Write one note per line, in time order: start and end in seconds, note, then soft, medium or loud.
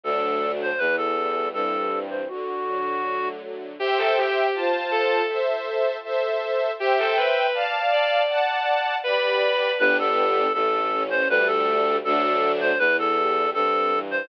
0.04 0.73 D2 medium
0.04 0.72 F#3 medium
0.04 0.72 A3 medium
0.04 0.72 D4 medium
0.04 0.52 A4 medium
0.62 0.80 C5 medium
0.78 1.47 E2 medium
0.78 1.92 E3 medium
0.78 0.96 B4 medium
0.97 1.49 A4 medium
1.17 2.24 G3 medium
1.54 2.22 G2 medium
1.54 2.25 C4 medium
1.54 1.99 A4 medium
1.92 2.28 E3 medium
2.11 2.28 C5 medium
2.28 3.41 D3 medium
2.28 3.29 F#4 medium
2.67 3.73 F#3 medium
3.04 3.75 A3 medium
3.42 3.78 D3 medium
3.79 3.98 G4 loud
3.79 4.47 C5 loud
3.79 4.47 E5 loud
3.79 4.47 G5 loud
3.98 4.15 A4 medium
4.17 4.52 G4 medium
4.54 5.22 F4 loud
4.54 5.22 C5 loud
4.54 5.22 A5 loud
4.91 5.23 A4 medium
5.29 5.97 A4 loud
5.29 5.97 C5 loud
5.29 5.97 E5 medium
6.04 6.72 A4 loud
6.04 6.72 C5 loud
6.04 6.72 E5 loud
6.79 6.98 G4 loud
6.79 7.46 C5 loud
6.79 7.46 E5 loud
6.79 7.46 G5 loud
6.98 7.16 A4 medium
7.17 7.51 B4 medium
7.54 8.22 D5 medium
7.54 8.22 F5 loud
7.54 8.22 A5 loud
7.93 8.25 D5 medium
8.29 8.96 D5 loud
8.29 8.96 F#5 loud
8.29 8.96 A5 loud
9.04 9.72 G4 medium
9.04 9.70 B4 medium
9.04 9.72 D5 loud
9.04 9.72 B5 loud
9.79 10.49 G1 loud
9.79 10.47 B3 loud
9.79 10.47 D4 loud
9.79 10.47 G4 loud
9.79 9.97 B4 loud
9.99 10.53 A4 medium
10.53 11.23 A1 loud
10.53 10.91 A3 loud
10.53 11.03 A4 medium
10.92 11.28 C#4 loud
11.10 11.28 C5 medium
11.29 11.99 D2 loud
11.29 11.97 G3 loud
11.29 11.97 A3 loud
11.29 11.97 D4 loud
11.29 11.48 B4 loud
11.47 11.97 A4 medium
12.04 12.74 D2 loud
12.04 12.72 F#3 loud
12.04 12.72 A3 loud
12.04 12.72 D4 loud
12.04 12.52 A4 medium
12.61 12.78 C5 medium
12.79 13.47 E2 loud
12.79 13.17 E3 loud
12.79 12.97 B4 loud
12.99 13.50 A4 medium
13.17 13.54 G3 medium
13.54 14.22 G2 medium
13.54 13.92 C4 medium
13.54 13.99 A4 medium
13.91 14.27 E3 medium
14.11 14.28 C5 medium